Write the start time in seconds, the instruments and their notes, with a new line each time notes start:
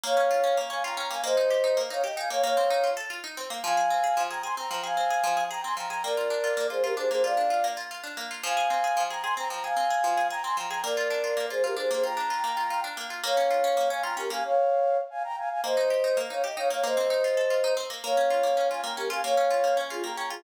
0.04 pizzicato strings A#3, flute C#5 F5
0.17 pizzicato strings C#4
0.31 pizzicato strings F4
0.44 pizzicato strings C#4
0.57 pizzicato strings A#3
0.70 pizzicato strings C#4, flute F5 G#5
0.84 pizzicato strings F4, flute G5 A#5
0.97 pizzicato strings C#4, flute G5 A#5
1.11 pizzicato strings A#3, flute F5 G#5
1.24 pizzicato strings A#3, flute C5 D#5
1.37 pizzicato strings D#4
1.50 pizzicato strings G4
1.64 pizzicato strings D#4
1.77 pizzicato strings A#3
1.90 pizzicato strings D#4, flute C#5 F5
2.04 pizzicato strings G4, flute D#5 G5
2.17 pizzicato strings D#4, flute F5 G#5
2.30 pizzicato strings A#3, flute C#5 F5
2.43 pizzicato strings A#3, flute C#5 F5
2.57 pizzicato strings C4
2.70 pizzicato strings D#4
2.84 pizzicato strings F4
2.97 pizzicato strings A4
3.10 pizzicato strings F4
3.24 pizzicato strings D#4
3.37 pizzicato strings C4
3.50 pizzicato strings A#3
3.63 pizzicato strings F3, flute F5 G#5
3.77 pizzicato strings G#4
3.90 pizzicato strings C4
4.04 pizzicato strings G#4
4.17 pizzicato strings F3
4.30 pizzicato strings G#4, flute G5 A#5
4.43 pizzicato strings G#4, flute G#5 C6
4.57 pizzicato strings C4, flute G5 A#5
4.71 pizzicato strings F3, flute G5 A#5
4.84 pizzicato strings G#4, flute F5 G#5
4.97 pizzicato strings C4
5.10 pizzicato strings G#4
5.24 pizzicato strings F3
5.37 pizzicato strings G#4
5.50 pizzicato strings G#4, flute G5 A#5
5.64 pizzicato strings C4, flute G#5 C6
5.77 pizzicato strings F3, flute G5 A#5
5.90 pizzicato strings G#4, flute G5 A#5
6.04 pizzicato strings A#3, flute A#4 D5
6.17 pizzicato strings F4
6.30 pizzicato strings D4
6.44 pizzicato strings F4
6.57 pizzicato strings A#3
6.70 pizzicato strings F4, flute G#4 C5
6.83 pizzicato strings F4, flute G4 A#4
6.97 pizzicato strings D4, flute G#4 C5
7.10 pizzicato strings A#3, flute G#4 C5
7.24 pizzicato strings F4, flute D5 F5
7.37 pizzicato strings D4
7.50 pizzicato strings F4
7.64 pizzicato strings A#3
7.77 pizzicato strings F4
7.91 pizzicato strings F4
8.04 pizzicato strings D4
8.17 pizzicato strings A#3
8.31 pizzicato strings F4
8.43 pizzicato strings F3, flute F5 G#5
8.57 pizzicato strings G#4
8.70 pizzicato strings C4
8.84 pizzicato strings G#4
8.97 pizzicato strings F3
9.10 pizzicato strings G#4, flute G5 A#5
9.23 pizzicato strings G#4, flute G#5 C6
9.37 pizzicato strings C4, flute G5 A#5
9.50 pizzicato strings F3, flute G5 A#5
9.64 pizzicato strings G#4, flute F5 G#5
9.77 pizzicato strings C4
9.90 pizzicato strings G#4
10.04 pizzicato strings F3
10.17 pizzicato strings G#4
10.30 pizzicato strings G#4, flute G5 A#5
10.44 pizzicato strings C4, flute G#5 C6
10.57 pizzicato strings F3, flute G5 A#5
10.70 pizzicato strings G#4, flute G5 A#5
10.83 pizzicato strings A#3, flute A#4 D5
10.97 pizzicato strings F4
11.10 pizzicato strings D4
11.24 pizzicato strings F4
11.37 pizzicato strings A#3
11.50 pizzicato strings F4, flute G#4 C5
11.64 pizzicato strings F4, flute G4 A#4
11.77 pizzicato strings D4, flute G#4 C5
11.91 pizzicato strings A#3, flute G#4 C5
12.03 pizzicato strings F4, flute G5 A#5
12.17 pizzicato strings D4
12.30 pizzicato strings F4
12.44 pizzicato strings A#3
12.57 pizzicato strings F4
12.70 pizzicato strings F4
12.84 pizzicato strings D4
12.97 pizzicato strings A#3
13.10 pizzicato strings F4
13.24 pizzicato strings A#3, flute C#5 F5
13.37 pizzicato strings C#4
13.51 pizzicato strings F4
13.64 pizzicato strings C#4
13.77 pizzicato strings A#3
13.90 pizzicato strings C#4, flute F5 G#5
14.03 pizzicato strings F4, flute G5 A#5
14.17 pizzicato strings C#4, flute G4 A#4
14.30 pizzicato strings A#3, flute F5 G#5
14.44 flute C#5 F5
15.10 flute F5 G#5
15.24 flute G5 A#5
15.37 flute F5 G#5
15.50 flute F5 G#5
15.63 pizzicato strings A#3, flute C5 D#5
15.77 pizzicato strings D#4
15.90 pizzicato strings G4
16.04 pizzicato strings D#4
16.17 pizzicato strings A#3
16.30 pizzicato strings D#4, flute C#5 F5
16.44 pizzicato strings G4, flute D#5 G5
16.57 pizzicato strings D#4, flute C#5 F5
16.70 pizzicato strings A#3, flute C#5 F5
16.84 pizzicato strings A#3, flute C5 D#5
16.97 pizzicato strings C4
17.10 pizzicato strings D#4
17.24 pizzicato strings F4
17.37 pizzicato strings A4
17.50 pizzicato strings F4
17.64 pizzicato strings D#4
17.77 pizzicato strings C4
17.90 pizzicato strings A#3
18.04 pizzicato strings A#3, flute C#5 F5
18.17 pizzicato strings C#4
18.30 pizzicato strings F4
18.43 pizzicato strings A#3
18.57 pizzicato strings C#4
18.70 pizzicato strings F4, flute F5 G#5
18.84 pizzicato strings A#3, flute G5 A#5
18.97 pizzicato strings C#4, flute G4 A#4
19.10 pizzicato strings F4, flute F5 G#5
19.24 pizzicato strings A#3, flute C#5 F5
19.37 pizzicato strings C#4
19.51 pizzicato strings F4
19.64 pizzicato strings A#3
19.77 pizzicato strings C#4
19.90 flute F4 G#4, pizzicato strings F4
20.04 pizzicato strings A#3, flute G5 A#5
20.17 pizzicato strings C#4, flute G5 A#5
20.30 pizzicato strings F4, flute F4 G#4